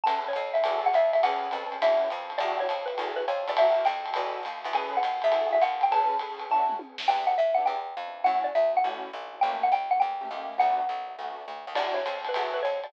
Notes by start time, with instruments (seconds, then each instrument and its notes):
0.03 electric bass (finger) E2, acoustic grand piano C#4 G#4 A4 B4, xylophone A5, ride
0.28 xylophone C#5
0.33 electric bass (finger) F2, kick, hi-hat pedal, ride
0.54 xylophone E5, ride
0.64 electric bass (finger) E2, acoustic grand piano E4 F#4 G#4 A4, ride
0.86 xylophone F#5
0.93 electric bass (finger) F2, xylophone E5, hi-hat pedal, ride
1.13 xylophone E5, ride
1.23 electric bass (finger) E2, acoustic grand piano C#4 G#4 A4 B4, xylophone F#5, ride
1.51 electric bass (finger) F2, acoustic grand piano C#4 G#4 A4 B4, hi-hat pedal, ride
1.72 ride
1.82 electric bass (finger) E2, acoustic grand piano C#4 D4 E4 F#4, xylophone E5, ride
2.10 electric bass (finger) F2, kick, hi-hat pedal, ride
2.30 ride
2.38 electric bass (finger) E2, acoustic grand piano D4 E4 F#4 G4, xylophone D5, ride
2.60 xylophone C#5
2.69 electric bass (finger) F2, hi-hat pedal, ride
2.86 xylophone B4, ride
2.98 electric bass (finger) E2, acoustic grand piano E4 F#4 G#4 A4, ride
3.16 xylophone B4
3.28 electric bass (finger) F2, xylophone C#5, hi-hat pedal, ride
3.48 electric bass (finger) E2, xylophone D5, ride
3.57 acoustic grand piano E4 F#4 G4 A#4, xylophone E5, ride
3.85 electric bass (finger) F2, xylophone G5, hi-hat pedal, ride
4.06 ride
4.14 electric bass (finger) E2, acoustic grand piano D#4 F#4 A4 B4, ride
4.43 electric bass (finger) D#2, hi-hat pedal, ride
4.64 electric bass (finger) E2, ride
4.73 acoustic grand piano C#4 G#4 A4 B4, xylophone G#5, ride
4.97 xylophone F#5
5.03 electric bass (finger) D#2, hi-hat pedal, ride
5.22 electric bass (finger) E2, xylophone E5, ride
5.32 acoustic grand piano E4 F#4 G#4 A4, ride
5.52 xylophone E5
5.62 electric bass (finger) D#2, xylophone F#5, kick, hi-hat pedal, ride
5.81 xylophone G5, ride
5.91 acoustic grand piano C#4 G#4 A4 B4, xylophone A5, ride
6.19 acoustic grand piano C#4 G#4 A4 B4, hi-hat pedal, ride
6.40 ride
6.50 acoustic grand piano C#4 D4 E4 F#4, xylophone A5, kick
6.69 mid tom
6.79 high tom
6.98 snare
7.08 electric bass (finger) E2, acoustic grand piano B3 D4 E4 G4, xylophone G5
7.27 xylophone F#5
7.38 electric bass (finger) G2, xylophone E5
7.54 acoustic grand piano B3 D4 E4 G4, xylophone F#5
7.65 electric bass (finger) E2, xylophone G5
7.97 electric bass (finger) F2
8.24 electric bass (finger) F#2, acoustic grand piano A3 C#4 E4 F#4, xylophone F#5
8.44 xylophone D5
8.55 electric bass (finger) D2, xylophone E5
8.77 xylophone F#5
8.84 electric bass (finger) A1, acoustic grand piano A3 C#4 E4 F#4
9.13 electric bass (finger) A#1
9.41 electric bass (finger) A1, acoustic grand piano A3 A#3 C#4 G4, xylophone G5
9.63 xylophone F#5
9.72 electric bass (finger) C#2, xylophone G5
9.91 xylophone F#5
10.00 electric bass (finger) E2, xylophone G5
10.21 acoustic grand piano A3 A#3 C#4 G4
10.31 electric bass (finger) D#2, acoustic grand piano A3 A#3 C#4 G4
10.58 electric bass (finger) D2, acoustic grand piano A3 B3 D4 F#4, xylophone F#5
10.89 electric bass (finger) B1
11.19 electric bass (finger) D2, acoustic grand piano A3 B3 D4 F#4
11.48 electric bass (finger) D2
11.67 electric bass (finger) D#2
11.75 electric bass (finger) E2, acoustic grand piano D4 E4 F#4 G4, xylophone D5, crash, ride
11.94 xylophone C#5
12.06 electric bass (finger) F2, hi-hat pedal, ride
12.25 xylophone B4, ride
12.34 electric bass (finger) E2, acoustic grand piano E4 F#4 G#4 A4, kick, ride
12.54 xylophone B4
12.63 electric bass (finger) F2, xylophone C#5, hi-hat pedal, ride
12.84 xylophone D5, ride